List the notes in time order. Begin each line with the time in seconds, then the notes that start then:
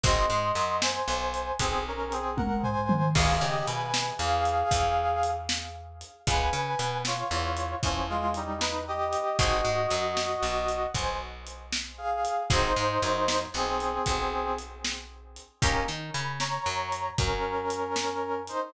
0.04 G#1 C4 D#4 F#4 G#4 D#5 C6, kick, closed hi-hat
0.30 G#2 G#3
0.55 F#2 F#3, closed hi-hat
0.81 C5 G#5, snare
1.08 B1 B3
1.34 closed hi-hat
1.60 B1 B3 C4 G#4, kick, closed hi-hat
1.88 C#4 A#4
2.12 C4 G#4, closed hi-hat
2.37 A#4 F#5, kick, high tom
2.63 C5 G#5, floor tom
2.89 mid tom
3.15 C#2 B3 C#4 F4 G#4 F5, kick, crash
3.41 C#3 C#4 G4 D#5
3.67 B2 B3 B4 G#5, closed hi-hat
3.94 snare
4.19 E2 E3 G#4 F5
4.45 closed hi-hat
4.71 E2 E3, kick, closed hi-hat
5.23 closed hi-hat
5.49 snare
6.01 closed hi-hat
6.27 C#2 B3 C#4 F4 G#4 B4 G#5, kick, closed hi-hat
6.53 C#3 C#4
6.79 B2 B3, closed hi-hat
7.05 F4 C#5, snare
7.31 E2 E3
7.57 closed hi-hat
7.82 E2 E3 F3 C#4, kick, closed hi-hat
8.09 G#3 F4
8.34 G3 D#4, closed hi-hat
8.60 D#4 B4, snare
8.88 G4 D#5
9.13 closed hi-hat
9.38 G#1 C4 D#4 F#4 G#4 D#5, kick, closed hi-hat
9.65 G#2 G#3
9.90 F#2 F#3, closed hi-hat
10.17 snare
10.43 B1 B3
10.69 closed hi-hat
10.94 B1 B3 C5 G#5, kick, closed hi-hat
11.47 closed hi-hat
11.73 snare
11.98 G#4 F5
12.25 closed hi-hat
12.50 G#1 C4 D#4 F#4 G#4 C5, kick, closed hi-hat
12.76 G#2 G#3
13.02 F#2 F#3, closed hi-hat
13.28 snare
13.54 B1 B3 C4 G#4
13.80 closed hi-hat
14.06 B1 B3, kick, closed hi-hat
14.59 closed hi-hat
14.85 snare
15.36 closed hi-hat
15.62 D#2 A#3 C#4 D#4 G4 A#4, kick, closed hi-hat
15.88 D#3 D#4
16.14 C#3 C#4 B5, closed hi-hat
16.40 C#5 A#5, snare
16.66 F#2 F#3
16.92 closed hi-hat
17.18 F#2 F#3 C#4 A#4, kick, closed hi-hat
17.70 closed hi-hat
17.96 snare
18.48 D#4 C5, closed hi-hat